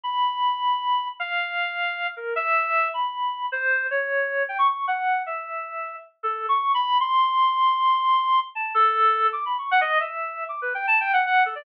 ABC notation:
X:1
M:6/4
L:1/16
Q:1/4=155
K:none
V:1 name="Clarinet"
b12 f10 ^A2 | e6 b6 c4 ^c6 g ^c' | ^c'2 ^f4 e8 z2 (3A4 c'4 b4 | c'16 a2 A6 |
(3d'2 b2 ^c'2 ^f ^d2 e5 (3=d'2 B2 g2 (3a2 g2 f2 f2 A =d |]